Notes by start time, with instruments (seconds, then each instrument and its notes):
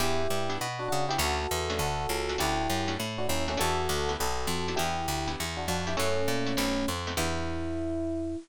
0.00 electric bass (finger) E2, acoustic guitar (steel) B3 D4 E4 G4, electric piano 1 E4 G4
0.30 electric bass (finger) G2
0.50 acoustic guitar (steel) B3 D4 E4 G4
0.61 electric bass (finger) B2
0.79 electric piano 1 D4 F#4
0.88 electric bass (finger) C#3, electric piano 1 D4 F#4
1.09 acoustic guitar (steel) B3 D4 E4 G4, electric piano 1 E4 G4
1.18 electric bass (finger) D2, acoustic guitar (steel) A3 C#4 D4 F#4, electric piano 1 F#4 A4
1.51 electric bass (finger) E2
1.70 acoustic guitar (steel) A3 C#4 D4 F#4
1.79 electric bass (finger) D2, electric piano 1 F#4 A4
2.09 electric bass (finger) C#2
2.29 acoustic guitar (steel) A3 C#4 D4 F#4
2.38 electric bass (finger) D2, acoustic guitar (steel) A3 C#4 D4 F#4, electric piano 1 E4 G4
2.70 electric bass (finger) F#2
2.88 acoustic guitar (steel) A3 C#4 D4 F#4
3.00 electric bass (finger) A2
3.18 electric piano 1 D4 F#4
3.28 electric bass (finger) D#2, electric piano 1 C#4 E4
3.48 acoustic guitar (steel) A3 C#4 D4 F#4, electric piano 1 A3 C#4
3.57 electric bass (finger) E2, acoustic guitar (steel) B3 D4 E4 G4, electric piano 1 F#4 A4
3.89 electric bass (finger) D2
4.09 acoustic guitar (steel) B3 D4 E4 G4
4.20 electric bass (finger) B1, electric piano 1 F#4 A4
4.47 electric bass (finger) F2
4.68 acoustic guitar (steel) B3 D4 E4 G4
4.76 electric bass (finger) E2, acoustic guitar (steel) B3 D4 E4 G4, electric piano 1 E4 G4
5.08 electric bass (finger) D2
5.28 acoustic guitar (steel) B3 D4 E4 G4
5.40 electric bass (finger) E2
5.57 electric piano 1 D4 F#4
5.68 electric bass (finger) F2, electric piano 1 D4 F#4
5.87 acoustic guitar (steel) B3 D4 E4 G4, electric piano 1 E4 G4
5.97 electric bass (finger) F#2, electric piano 1 A3 C#4, acoustic guitar (steel) A3 C#4 E4 F#4
6.28 electric bass (finger) A#2
6.46 acoustic guitar (steel) A3 C#4 E4 F#4
6.57 electric bass (finger) B1, acoustic guitar (steel) A3 B3 C4 D#4
6.88 electric bass (finger) F2
7.07 acoustic guitar (steel) A3 B3 C4 D#4
7.17 electric bass (finger) E2, acoustic guitar (steel) B3 D4 E4 G4, electric piano 1 E4